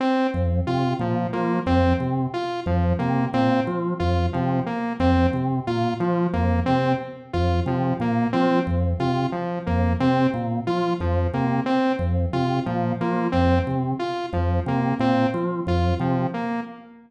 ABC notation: X:1
M:5/4
L:1/8
Q:1/4=90
K:none
V:1 name="Drawbar Organ" clef=bass
z F,, C, _B,, F, F,, C, z F,, C, | _B,, F, F,, C, z F,, C, B,, F, F,, | C, z F,, C, _B,, F, F,, C, z F,, | C, _B,, F, F,, C, z F,, C, B,, F, |
F,, C, z F,, C, _B,, F, F,, C, z |]
V:2 name="Lead 2 (sawtooth)"
C z F F, _B, C z F F, B, | C z F F, _B, C z F F, B, | C z F F, _B, C z F F, B, | C z F F, _B, C z F F, B, |
C z F F, _B, C z F F, B, |]